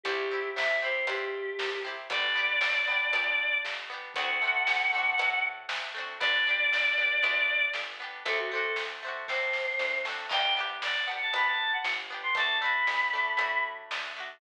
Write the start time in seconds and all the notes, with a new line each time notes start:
0.03 C2 C4 E4 G4, kick, closed hi-hat
0.09 G4
0.31 C4 E4 G4
0.55 C2 E5, snare
0.82 C4 E4 G4 C5
1.07 G2 C4 E4 G4, closed hi-hat
1.11 G4
1.59 C2, snare
1.84 C4 E4 G4
2.10 G1 B3 D4 D5, kick, closed hi-hat
2.14 G4
2.35 B3 D4 G4
2.61 G1, snare
2.88 B3 D4 G4
3.13 D2 B3 D4 G4, closed hi-hat
3.65 G1, snare
3.90 B3 D4 G4
4.14 D2 A3 C4 F#5, kick, closed hi-hat
4.20 D4 F#4
4.42 A3 C4 D4
4.47 F#4
4.67 D2, snare
4.93 A3 C4 D4
4.98 F#4
5.18 A2 A3 C4 D4, closed hi-hat
5.24 F#4
5.69 D2, snare
5.95 A3 C4 D4
6.00 F#4
6.20 G1 B3 D4 D5, kick, closed hi-hat
6.24 G4
6.47 B3 D4 G4
6.72 G1, snare
6.98 B3 D4 G4
7.23 D2 B3 D4 G4, closed hi-hat
7.73 G1, snare
8.00 B3 D4 G4
8.25 D2 A3 C4 D4 A4, kick, closed hi-hat
8.31 F#4
8.38 F#4
8.51 A3 C4 D4 A4
8.57 F#4
8.76 D2, snare
9.03 A3 C4 D4
9.08 F#4
9.28 A2 A3 C4 D4 C5, kick, snare
9.34 F#4
9.53 snare
9.79 D2, snare
10.05 A3 C4, snare
10.09 D4 F#4
10.29 G1 B3 D4 G5, kick, crash
10.34 G4
10.57 B3 D4 G4
10.82 G1 D5, snare
11.06 B3 D4 F#5
11.11 G4
11.21 A5
11.33 D2 B3 D4 B5, closed hi-hat
11.38 G4
11.46 A5
11.73 F#5
11.84 G1, snare
12.10 B3 D4 G4
12.23 C6
12.35 D2 A3 D4 A5, kick, closed hi-hat
12.40 F#4
12.61 A3 D4 B5
12.65 F#4
12.87 D2, snare
13.13 A3 D4 F#4
13.37 A2 A3 D4, closed hi-hat
13.42 F#4
13.91 D2, snare
14.16 A3 D4 F#4